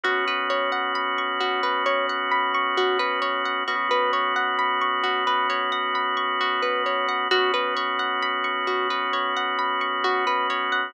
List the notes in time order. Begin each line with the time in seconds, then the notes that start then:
0.03 B1 B3 C#4 F#4
0.27 B4
0.50 C#5
0.72 F#5
0.95 B5
1.18 C#6
1.40 F#4
1.63 B4
1.86 C#5
2.09 F#5
2.31 B5
2.54 C#6
2.77 F#4
2.99 B4
3.22 C#5
3.45 F#5
3.67 B1 B3 C#4 F#4
3.91 B4
4.13 C#5
4.36 F#5
4.59 B5
4.81 C#6
5.03 F#4
5.27 B4
5.50 C#5
5.72 F#5
5.95 B5
6.17 C#6
6.41 F#4
6.62 B4
6.86 C#5
7.09 F#5
7.31 B1 B3 C#4 F#4
7.54 B4
7.77 C#5
7.99 F#5
8.22 B5
8.44 C#6
8.67 F#4
8.90 B4
9.13 C#5
9.37 F#5
9.59 B5
9.81 C#6
10.04 F#4
10.27 B4
10.50 C#5
10.72 F#5